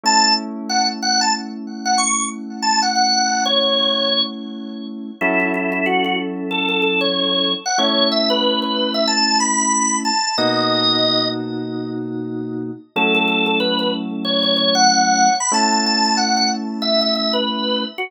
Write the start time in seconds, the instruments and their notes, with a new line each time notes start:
0.03 electric piano 2 A3 C#4 E4, drawbar organ A5
0.69 drawbar organ F#5
1.02 drawbar organ F#5
1.21 drawbar organ A5
1.85 drawbar organ F#5
1.98 drawbar organ C#6
2.62 drawbar organ A5
2.82 drawbar organ F#5
2.95 drawbar organ F#5
3.45 drawbar organ C#5
5.21 electric piano 2 F#3 C#4 E4 A4, drawbar organ E4
5.40 drawbar organ E4
5.54 drawbar organ E4
5.72 drawbar organ E4
5.86 drawbar organ F#4
6.04 drawbar organ F#4
6.51 drawbar organ A4
6.69 drawbar organ A4
6.82 drawbar organ A4
7.01 drawbar organ C#5
7.65 drawbar organ F#5
7.78 electric piano 2 A3 C#4 E4, drawbar organ C#5
8.11 drawbar organ E5
8.30 drawbar organ B4
8.62 drawbar organ B4
8.94 drawbar organ E5
9.07 drawbar organ A5
9.40 drawbar organ B5
10.05 drawbar organ A5
10.37 electric piano 2 B2 A#3 D#4 F#4, drawbar organ D#5
12.96 electric piano 2 F#3 A3 C#4 E4, drawbar organ A4
13.15 drawbar organ A4
13.28 drawbar organ A4
13.46 drawbar organ A4
13.60 drawbar organ B4
13.79 drawbar organ B4
14.24 drawbar organ C#5
14.43 drawbar organ C#5
14.56 drawbar organ C#5
14.75 drawbar organ F#5
15.40 drawbar organ B5
15.52 electric piano 2 A3 C#4 E4, drawbar organ A5
15.72 drawbar organ A5
15.86 drawbar organ A5
16.05 drawbar organ A5
16.17 drawbar organ F#5
16.37 drawbar organ F#5
16.82 drawbar organ E5
17.01 drawbar organ E5
17.15 drawbar organ E5
17.33 drawbar organ B4
17.98 drawbar organ F#4